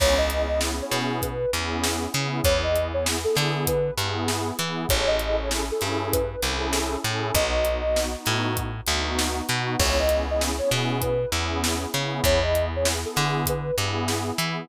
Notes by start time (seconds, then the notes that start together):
0.00 C#2 B3 C#4 E4 G#4 C#5, kick, crash
0.18 B3 C#4 E4 G#4 D#5
0.30 B3 C#4 E4 G#4, closed hi-hat
0.49 B3 C#4 E4 G#4 D#5
0.61 snare
0.79 B3 C#4 E4 G#4 C#5
0.91 B2, snare, closed hi-hat
1.22 B4, kick, closed hi-hat
1.53 E2 B3 C#4 E4 G#4, closed hi-hat
1.84 snare
2.14 C#3 B3 C#4 E4 G#4, closed hi-hat
2.44 E2 B3 E4 G#4 C#5, kick, closed hi-hat
2.63 B3 E4 G#4 D#5
2.76 B3 E4 G#4, closed hi-hat
2.94 B3 E4 G#4 C#5
3.06 snare
3.24 B3 E4 G#4 A4
3.35 D3, snare, closed hi-hat
3.67 B4, kick, closed hi-hat
3.98 G2 B3 E4 G#4, closed hi-hat
4.28 snare
4.59 E3 B3 E4 G#4, closed hi-hat
4.89 A1 C#4 E4 G#4 A4 C#5, kick, closed hi-hat
5.07 C#4 E4 G#4 A4 D#5
5.19 C#4 E4 G#4 A4, closed hi-hat
5.38 C#4 E4 G#4 A4 C#5
5.51 snare
5.71 C#4 E4 G#4 A4
5.81 G2, snare, closed hi-hat
6.13 B4, kick, closed hi-hat
6.42 C2 C#4 E4 G#4 A4, closed hi-hat
6.73 snare
7.04 A2 C#4 E4 G#4 A4, closed hi-hat
7.35 B1 B3 D#4 F#4 D#5, kick, closed hi-hat
7.55 B3 D#4 F#4
7.65 B3 D#4 F#4, closed hi-hat
7.86 B3 D#4 F#4
7.96 snare
8.15 B3 D#4 F#4
8.26 A2, snare, closed hi-hat
8.57 kick, closed hi-hat
8.86 D2 B3 D#4 F#4, closed hi-hat
9.19 snare
9.48 B2 B3 D#4 F#4, closed hi-hat
9.79 C#2 B3 C#4 E4 G#4 C#5, kick, crash
9.99 B3 C#4 E4 G#4 D#5
10.09 B3 C#4 E4 G#4, closed hi-hat
10.28 B3 C#4 E4 G#4 D#5
10.41 snare
10.59 B3 C#4 E4 G#4 C#5
10.71 B2, snare, closed hi-hat
11.02 B4, kick, closed hi-hat
11.32 E2 B3 C#4 E4 G#4, closed hi-hat
11.64 snare
11.94 C#3 B3 C#4 E4 G#4, closed hi-hat
12.24 E2 B3 E4 G#4 C#5, kick, closed hi-hat
12.42 B3 E4 G#4 D#5
12.54 B3 E4 G#4, closed hi-hat
12.74 B3 E4 G#4 C#5
12.85 snare
13.05 B3 E4 G#4 A4
13.16 D3, snare, closed hi-hat
13.46 B4, kick, closed hi-hat
13.78 G2 B3 E4 G#4, closed hi-hat
14.08 snare
14.38 E3 B3 E4 G#4, closed hi-hat